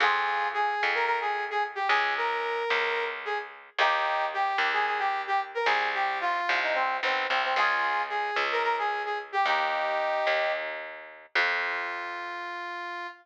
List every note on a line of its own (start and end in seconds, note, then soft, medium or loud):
0.00 0.75 F2 loud
0.00 0.48 F4 loud
0.00 0.48 G#4 loud
0.54 0.91 G#4 loud
0.83 1.82 F2 medium
0.95 1.05 A#4 loud
1.06 1.19 A#4 loud
1.21 1.44 G#4 loud
1.50 1.63 G#4 loud
1.75 1.88 G4 loud
1.88 2.64 C#2 loud
1.88 2.14 G#4 loud
2.17 3.04 A#4 loud
2.70 3.70 C#2 medium
3.25 3.38 G#4 loud
3.78 4.53 D#2 loud
3.78 4.25 D#4 loud
3.78 4.25 G4 loud
4.34 4.72 G4 loud
4.58 5.58 D#2 medium
4.73 4.86 G#4 loud
4.87 4.99 G#4 loud
4.99 5.22 G4 loud
5.27 5.40 G4 loud
5.55 5.67 A#4 loud
5.65 6.41 C2 loud
5.65 5.90 G#4 loud
5.94 6.18 G4 loud
6.21 6.59 F4 loud
6.49 7.00 C2 medium
6.63 6.75 D#4 loud
6.74 6.97 C4 loud
7.03 7.27 B1 medium
7.03 7.26 C4 loud
7.29 7.54 C2 medium
7.29 7.42 C4 loud
7.44 7.57 C4 loud
7.56 8.31 C#2 loud
7.56 8.02 F4 loud
7.56 8.02 G#4 loud
8.09 8.43 G#4 loud
8.36 9.36 C#2 medium
8.52 8.63 A#4 loud
8.63 8.76 A#4 loud
8.79 9.02 G#4 loud
9.05 9.18 G#4 medium
9.32 9.45 G4 loud
9.45 10.20 D#2 medium
9.45 10.52 D#4 loud
9.45 10.52 G4 loud
10.27 11.26 D#2 medium
11.35 13.07 F2 loud
11.35 13.07 F4 loud